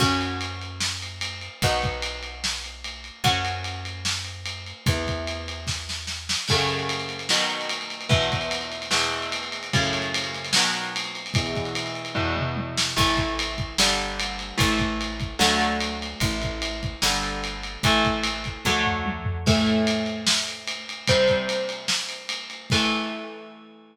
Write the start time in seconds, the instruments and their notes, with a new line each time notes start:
0.00 electric bass (finger) F#2, overdriven guitar C#4 F#4, kick, crash
0.21 ride
0.41 ride
0.61 ride
0.80 snare
1.02 ride
1.21 ride
1.41 ride
1.62 electric bass (finger) B1, overdriven guitar B3 D#4 F#4, kick, ride
1.82 kick, ride
2.02 ride
2.23 ride
2.44 snare
2.64 ride
2.84 ride
3.04 ride
3.24 electric bass (finger) F#2, overdriven guitar C#4 F#4, kick, ride
3.45 ride
3.64 ride
3.85 ride
4.05 snare
4.25 ride
4.46 ride
4.66 ride
4.86 electric bass (finger) E2, overdriven guitar B3 E4, kick, ride
5.07 kick, ride
5.27 ride
5.48 ride
5.67 kick, snare
5.89 snare
6.07 snare
6.29 snare
6.48 overdriven guitar F#2 C#3 A3, kick, crash
6.58 ride
6.69 ride
6.79 ride
6.89 ride
6.99 ride
7.09 ride
7.19 ride
7.29 overdriven guitar B2 D#3 F#3, snare
7.40 ride
7.50 ride
7.61 ride
7.69 ride
7.81 ride
7.90 ride
8.01 ride
8.09 overdriven guitar E2 B2 E3, kick, ride
8.22 ride
8.32 kick, ride
8.41 ride
8.51 ride
8.61 ride
8.72 ride
8.82 ride
8.91 overdriven guitar E2 B2 E3, snare
9.01 ride
9.12 ride
9.22 ride
9.32 ride
9.43 ride
9.52 ride
9.63 ride
9.73 overdriven guitar F#2 A2 C#3, kick, ride
9.84 ride
9.93 ride
10.02 ride
10.14 ride
10.24 ride
10.34 ride
10.45 ride
10.53 overdriven guitar B2 D#3 F#3, snare
10.64 ride
10.74 ride
10.84 ride
10.96 ride
11.04 ride
11.15 ride
11.26 ride
11.34 overdriven guitar E2 B2 E3, kick, ride
11.46 ride
11.55 kick, ride
11.65 ride
11.75 ride
11.86 ride
11.95 ride
12.05 ride
12.15 overdriven guitar E2 B2 E3, kick, floor tom
12.37 mid tom
12.56 high tom
12.77 snare
12.96 electric bass (finger) A1, overdriven guitar E3 A3, kick, crash
13.17 kick, ride
13.39 ride
13.58 kick, ride
13.78 electric bass (finger) G1, overdriven guitar D3 G3, snare
13.98 ride
14.20 ride
14.39 ride
14.58 electric bass (finger) A1, overdriven guitar E3 A3, kick, ride
14.79 kick, ride
15.01 ride
15.20 kick, ride
15.39 electric bass (finger) D2, overdriven guitar D3 F#3 A3, snare
15.61 ride
15.80 ride
16.02 ride
16.20 electric bass (finger) A1, overdriven guitar E3 A3, kick, ride
16.42 kick, ride
16.62 ride
16.83 kick, ride
17.02 electric bass (finger) G1, overdriven guitar D3 G3, snare
17.23 ride
17.44 ride
17.63 ride
17.83 electric bass (finger) A1, overdriven guitar E3 A3, kick, ride
18.05 kick, ride
18.23 ride
18.44 kick, ride
18.65 electric bass (finger) D2, overdriven guitar D3 F#3 A3, kick, high tom
18.86 floor tom
19.06 high tom
19.25 floor tom
19.46 overdriven guitar A2 E3 A3, kick, crash
19.66 ride
19.87 ride
20.06 ride
20.27 snare
20.48 ride
20.67 ride
20.89 ride
21.08 overdriven guitar C3 G3 C4, kick, ride
21.28 kick, ride
21.49 ride
21.69 ride
21.88 snare
22.09 ride
22.29 ride
22.50 ride
22.70 overdriven guitar E3 A3, kick, crash